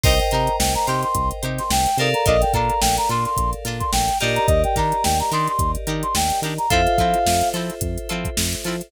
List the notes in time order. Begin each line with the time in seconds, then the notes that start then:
0.03 C2 D#4 G4 A#4 C5 D#5 G5, kick, crash
0.19 G5, closed hi-hat
0.31 C3 D#4 G4 A#4 C5 A#5, closed hi-hat
0.47 closed hi-hat
0.59 C2 G5, snare
0.75 A#5, closed hi-hat
0.87 C3 D#4 G4 A#4 C5 C6, closed hi-hat
1.03 C6, closed hi-hat
1.15 C2, kick, closed hi-hat
1.31 closed hi-hat
1.43 C3 D#4 G4 A#4 C5, closed hi-hat
1.58 C6, snare, closed hi-hat
1.70 C2 G5, snare
1.86 closed hi-hat
1.97 C3 D#4 G4 A4 A#4 C5 D5 F5, closed hi-hat
2.14 A#5, closed hi-hat
2.26 A#1 D4 F4 A4 A#4 D#5, kick, closed hi-hat
2.41 G5, snare, closed hi-hat
2.53 A#2 D4 F4 A4 A#4 A#5, kick, closed hi-hat
2.70 closed hi-hat
2.81 A#1 G5, snare
2.97 A#5, closed hi-hat
3.09 A#2 D4 F4 A4 A#4 C6, closed hi-hat
3.25 C6, closed hi-hat
3.37 A#1, kick, closed hi-hat
3.53 closed hi-hat
3.65 A#2 D4 F4 A4 A#4, snare, closed hi-hat
3.80 C6, kick, closed hi-hat
3.92 A#1 G5, snare
4.08 snare, closed hi-hat
4.20 A#2 D4 D#4 G4 A#4 D5 D#5, snare, closed hi-hat
4.35 A#5, closed hi-hat
4.47 D#2 D#5, kick, closed hi-hat
4.64 G5, closed hi-hat
4.76 D#3 D4 D#4 G4 A#4 A#5, kick, snare, closed hi-hat
4.92 closed hi-hat
5.04 D#2 G5, snare
5.20 A#5, closed hi-hat
5.31 D#3 D4 D#4 G4 A#4 C6, closed hi-hat
5.47 C6, closed hi-hat
5.59 D#2, kick, closed hi-hat
5.75 closed hi-hat
5.87 D#3 D4 D#4 G4 A#4, closed hi-hat
6.03 C6, closed hi-hat
6.15 D#2 G5, snare
6.30 snare, closed hi-hat
6.42 D#3 D4 D#4 G4 A#4, closed hi-hat
6.58 A#5, closed hi-hat
6.70 F2 C4 E4 F4 A4 C5 E5 F5, kick, closed hi-hat
6.87 closed hi-hat
6.98 F3 C4 E4 F4 A4, kick, closed hi-hat
7.14 closed hi-hat
7.26 F2, snare
7.41 closed hi-hat
7.54 F3 C4 E4 F4 A4, closed hi-hat
7.70 closed hi-hat
7.81 F2, kick, closed hi-hat
7.98 closed hi-hat
8.09 F3 C4 E4 F4 A4, closed hi-hat
8.25 kick, closed hi-hat
8.37 F2, snare
8.53 closed hi-hat
8.64 F3 C4 E4 F4 A4, closed hi-hat
8.81 closed hi-hat